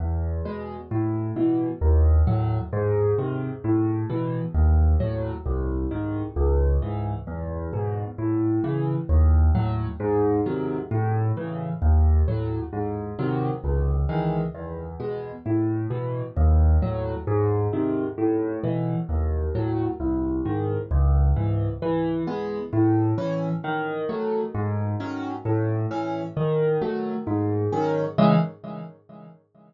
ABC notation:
X:1
M:6/8
L:1/8
Q:3/8=132
K:C#m
V:1 name="Acoustic Grand Piano"
E,,3 [B,,G,]3 | A,,3 [B,,E,]3 | D,,3 [A,,F,]3 | G,,3 [^B,,D,]3 |
A,,3 [B,,E,]3 | D,,3 [A,,F,]3 | ^B,,,3 [G,,D,]3 | C,,3 [G,,E,]3 |
E,,3 [G,,B,,]3 | A,,3 [C,E,]3 | D,,3 [A,,F,]3 | G,,3 [^B,,D,F,]3 |
A,,3 [C,E,]3 | D,,3 [A,,F,]3 | G,,3 [^B,,D,F,]3 | C,,3 [D,E,G,]3 |
E,,3 [B,,G,]3 | A,,3 [B,,E,]3 | D,,3 [A,,F,]3 | G,,3 [^B,,D,]3 |
A,,3 [B,,E,]3 | D,,3 [A,,F,]3 | ^B,,,3 [G,,D,]3 | C,,3 [G,,E,]3 |
E,3 [G,B,]3 | A,,3 [E,C]3 | D,3 [F,A,]3 | G,,3 [D,F,C]3 |
A,,3 [E,C]3 | D,3 [F,A,]3 | G,,3 [D,F,C]3 | [C,E,G,]3 z3 |]